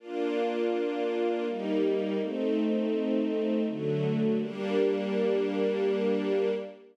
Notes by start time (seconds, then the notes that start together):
0.00 A#3 D4 F4
1.46 G3 A#3 D#4
2.19 A3 C4 D#4
3.66 D3 F#3 A3
4.39 G3 A#3 D4